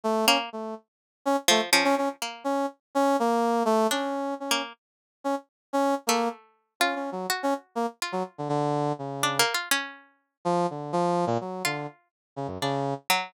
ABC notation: X:1
M:5/8
L:1/16
Q:1/4=124
K:none
V:1 name="Brass Section"
A,2 _D z A,2 z4 | _D z A, z D D D z3 | _D2 z2 D2 _B,4 | A,2 _D4 D2 z2 |
z3 _D z3 D2 z | _B,2 z4 (3_D2 D2 _G,2 | z _D z2 _B, z2 _G, z =D, | D,4 _D,4 z2 |
z6 F,2 D,2 | F,3 _B,, _G,2 D,2 z2 | z2 _D, _G,, D,3 z3 |]
V:2 name="Pizzicato Strings"
z2 _B,2 z6 | z2 F,2 F,4 _B,2 | z10 | z2 D5 _B,2 z |
z10 | A,6 F4 | _G6 F4 | z6 (3D2 _B,2 F2 |
_D6 z4 | z6 F4 | z4 D2 z2 _G,2 |]